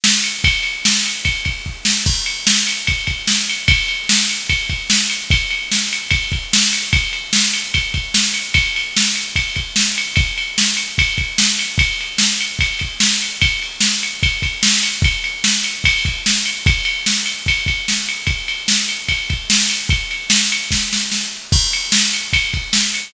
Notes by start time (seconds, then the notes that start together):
0.04 snare
0.24 ride
0.44 kick, ride
0.63 ride
0.85 snare
1.06 ride
1.25 kick, ride
1.45 kick, ride
1.66 kick
1.85 snare
2.06 kick, crash
2.26 ride
2.47 snare
2.67 ride
2.87 kick, ride
3.07 kick, ride
3.27 snare
3.49 ride
3.68 kick, ride
3.88 ride
4.09 snare
4.30 ride
4.49 kick, ride
4.70 kick, ride
4.90 snare
5.10 ride
5.30 kick, ride
5.50 ride
5.71 snare
5.93 ride
6.10 kick, ride
6.32 kick, ride
6.53 snare
6.73 ride
6.93 kick, ride
7.13 ride
7.33 snare
7.53 ride
7.74 kick, ride
7.94 kick, ride
8.14 snare
8.34 ride
8.54 kick, ride
8.76 ride
8.96 snare
9.16 ride
9.36 kick, ride
9.56 kick, ride
9.76 snare
9.98 ride
10.16 kick, ride
10.38 ride
10.58 snare
10.77 ride
10.98 kick, ride
11.18 kick, ride
11.38 snare
11.59 ride
11.78 kick, ride
12.01 ride
12.18 snare
12.41 ride
12.59 kick, ride
12.79 kick, ride
13.00 snare
13.22 ride
13.41 kick, ride
13.62 ride
13.80 snare
14.03 ride
14.23 kick, ride
14.42 kick, ride
14.63 snare
14.83 ride
15.02 kick, ride
15.24 ride
15.44 snare
15.64 ride
15.84 kick, ride
16.05 kick, ride
16.26 snare
16.46 ride
16.66 kick, ride
16.85 ride
17.06 snare
17.26 ride
17.46 kick, ride
17.66 kick, ride
17.88 snare
18.09 ride
18.27 kick, ride
18.48 ride
18.68 snare
18.89 ride
19.08 kick, ride
19.30 kick, ride
19.50 snare
19.70 ride
19.89 kick, ride
20.11 ride
20.30 snare
20.52 ride
20.71 kick, snare
20.93 snare
21.12 snare
21.52 kick, crash
21.73 ride
21.92 snare
22.13 ride
22.33 kick, ride
22.54 kick, ride
22.73 snare
22.94 ride